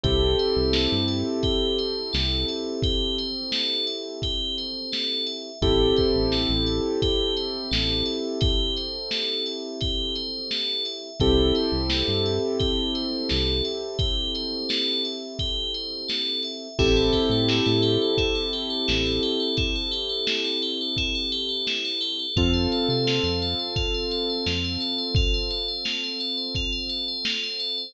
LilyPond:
<<
  \new Staff \with { instrumentName = "Tubular Bells" } { \time 4/4 \key a \minor \tempo 4 = 86 g'8 c''8 a'8 e''8 g'8 c''8 a'8 e''8 | g'8 c''8 a'8 e''8 g'8 c''8 a'8 e''8 | g'8 c''8 a'8 e''8 g'8 c''8 a'8 e''8 | g'8 c''8 a'8 e''8 g'8 c''8 a'8 e''8 |
g'8 c''8 a'8 e''8 g'8 c''8 a'8 e''8 | g'8 c''8 a'8 e''8 g'8 c''8 a'8 e''8 | e'16 a'16 g'16 a'16 e'16 a'16 g'16 a'16 e'16 a'16 g'16 a'16 e'16 a'16 g'16 a'16 | e'16 a'16 g'16 a'16 e'16 a'16 g'16 a'16 e'16 a'16 g'16 a'16 e'16 a'16 g'16 a'16 |
f'16 c''16 a'16 c''16 f'16 c''16 a'16 c''16 f'16 c''16 a'16 c''16 f'16 c''16 a'16 c''16 | f'16 c''16 a'16 c''16 f'16 c''16 a'16 c''16 f'16 c''16 a'16 c''16 f'16 c''16 a'16 c''16 | }
  \new Staff \with { instrumentName = "Acoustic Grand Piano" } { \time 4/4 \key a \minor <c' e' g' a'>1~ | <c' e' g' a'>1 | <c' e' g' a'>1~ | <c' e' g' a'>1 |
<c' e' g' a'>1~ | <c' e' g' a'>1 | <c' e' g' a'>1~ | <c' e' g' a'>1 |
<c' f' a'>1~ | <c' f' a'>1 | }
  \new Staff \with { instrumentName = "Synth Bass 1" } { \clef bass \time 4/4 \key a \minor c,8. c,8 g,4.~ g,16 c,4~ | c,1 | a,,8. a,,8 a,,4.~ a,,16 a,,4~ | a,,1 |
c,8. c,8 g,4.~ g,16 c,4~ | c,1 | a,,8. a,8 a,4.~ a,16 a,,4~ | a,,1 |
f,8. c8 f,4.~ f,16 f,4~ | f,1 | }
  \new DrumStaff \with { instrumentName = "Drums" } \drummode { \time 4/4 <hh bd>8 hh8 sn8 hh8 <hh bd>8 hh8 sn8 hh8 | <hh bd>8 hh8 sn8 hh8 <hh bd>8 hh8 sn8 hh8 | <hh bd>8 <hh bd>8 sn8 hh8 <hh bd>8 hh8 sn8 hh8 | <hh bd>8 hh8 sn8 hh8 <hh bd>8 hh8 sn8 hh8 |
<hh bd>8 hh8 sn8 hh8 <hh bd>8 hh8 sn8 hh8 | <hh bd>8 hh8 sn8 hh8 <hh bd>8 hh8 sn8 hh8 | <cymc bd>8 <hh bd>8 sn8 hh8 <hh bd>8 <hh sn>8 sn8 hh8 | <hh bd>8 hh8 sn8 hh8 <hh bd>8 hh8 sn8 hh8 |
<hh bd>8 hh8 sn8 hh8 <hh bd>8 hh8 sn8 hh8 | <hh bd>8 hh8 sn8 hh8 <hh bd>8 hh8 sn8 hh8 | }
>>